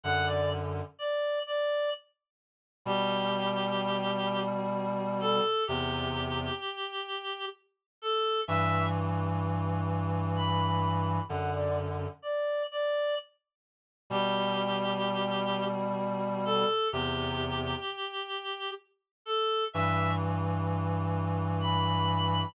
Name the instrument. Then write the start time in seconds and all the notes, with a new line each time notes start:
clarinet
0.04 F#2 D3 F#5
0.27 D5
0.99 D5
1.46 D5
2.85 B2 G3 G4
5.21 A4
5.67 E2 C3 G4
8.02 A4
8.47 G2 E3 E5
10.36 B5
11.29 F#2 D3 F#5
11.54 D5
12.22 D5
12.71 D5
14.10 B2 G3 G4
16.45 A4
16.92 E2 C3 G4
19.26 A4
19.73 G2 E3 E5
21.61 B5